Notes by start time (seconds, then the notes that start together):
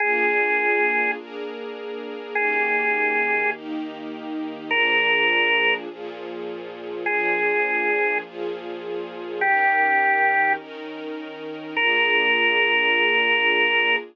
0.00 A#3 D4 F4 G#4
1.17 A#3 D4 G#4 A#4
2.35 D#3 A#3 C#4 G4 G#4
3.54 D#3 A#3 D#4 G4
4.71 A#2 F3 D4 G#4 A#4
5.88 A#2 F3 F4 G#4
7.06 A#2 F3 D4 G#4
8.24 A#2 F3 F4 G#4
9.40 D#3 C#4 G4 A#4
10.58 D#3 C#4 D#4 A#4
11.76 A#3 D4 F4 G#4 A#4